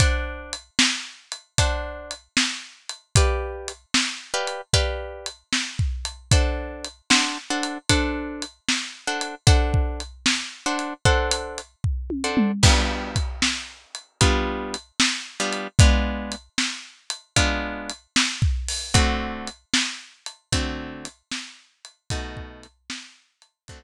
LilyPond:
<<
  \new Staff \with { instrumentName = "Acoustic Guitar (steel)" } { \time 4/4 \key d \major \tempo 4 = 76 <d' c'' fis'' a''>2 <d' c'' fis'' a''>2 | <g' b' d'' f''>4. <g' b' d'' f''>8 <g' b' d'' f''>2 | <d' a' c'' fis''>4 <d' a' c'' fis''>8 <d' a' c'' fis''>8 <d' a' c'' fis''>4. <d' a' c'' fis''>8 | <d' a' c'' fis''>4. <d' a' c'' fis''>8 <d' a' c'' fis''>4. <d' a' c'' fis''>8 |
<g b d' f'>2 <g b d' f'>4. <g b d' f'>8 | <gis b d' f'>2 <gis b d' f'>2 | <d a c' fis'>2 <d a c' fis'>2 | <b, a dis' fis'>2 <d a c' fis'>2 | }
  \new DrumStaff \with { instrumentName = "Drums" } \drummode { \time 4/4 \tuplet 3/2 { <hh bd>8 r8 hh8 sn8 r8 hh8 <hh bd>8 r8 hh8 sn8 r8 hh8 } | \tuplet 3/2 { <hh bd>8 r8 hh8 sn8 r8 hh8 <hh bd>8 r8 hh8 sn8 bd8 hh8 } | \tuplet 3/2 { <hh bd>8 r8 hh8 sn8 r8 hh8 <hh bd>8 r8 hh8 sn8 r8 hh8 } | \tuplet 3/2 { <hh bd>8 bd8 hh8 sn8 r8 hh8 bd8 hh8 hh8 bd8 tommh8 toml8 } |
\tuplet 3/2 { <cymc bd>8 r8 <hh bd>8 sn8 r8 hh8 <hh bd>8 r8 hh8 sn8 r8 hh8 } | \tuplet 3/2 { <hh bd>8 r8 hh8 sn8 r8 hh8 <hh bd>8 r8 hh8 sn8 bd8 hho8 } | \tuplet 3/2 { <hh bd>8 r8 hh8 sn8 r8 hh8 <hh bd>8 r8 hh8 sn8 r8 hh8 } | \tuplet 3/2 { <hh bd>8 bd8 hh8 sn8 r8 hh8 } <hh bd>4 r4 | }
>>